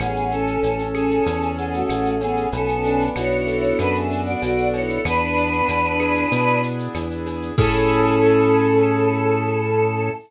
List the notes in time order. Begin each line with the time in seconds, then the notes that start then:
0.00 A1 B3 C#4 G#4, cowbell, claves, shaker
0.16 shaker
0.31 C#4 A4, shaker
0.47 shaker
0.63 A1 C#4, cowbell, shaker
0.79 shaker
0.95 C#4 G#4 A4, claves, shaker
1.11 shaker
1.26 E2 C#4, cowbell, shaker
1.42 shaker
1.58 B3 G#4 A4, shaker
1.74 A3 F#4, shaker
1.89 A1 G#4, cowbell, claves, shaker
2.05 shaker
2.21 B3 C#4 G#4, cowbell, shaker
2.37 shaker
2.52 B1 B3 C#4 A4, cowbell, shaker
2.68 shaker
2.84 D4, shaker
3.00 shaker
3.16 B1 E4 F#4 C#5, cowbell, claves, shaker
3.32 shaker
3.47 A4, shaker
3.63 shaker
3.79 F#2 B3 D4 B4, cowbell, claves, shaker
3.95 G#4 E5, shaker
4.10 D4, shaker
4.26 F#4 D5, shaker
4.42 B1 F#4 D5, cowbell, shaker
4.58 shaker
4.74 E4 A4 C#5, cowbell, shaker
4.89 shaker
5.05 E2 B3 D4 B4, cowbell, claves, shaker
5.21 shaker
5.37 D4, shaker
5.53 shaker
5.68 E2 E4, cowbell, shaker
5.84 shaker
6.00 G#4, claves, shaker
6.16 shaker
6.31 B2 B3, cowbell, shaker
6.47 shaker
6.63 D4, shaker
6.79 shaker
6.95 E2 E4, cowbell, claves, shaker
7.11 shaker
7.26 G#4, cowbell, shaker
7.42 shaker
7.58 A2 C#4 E4 G#4 A4, kick, crash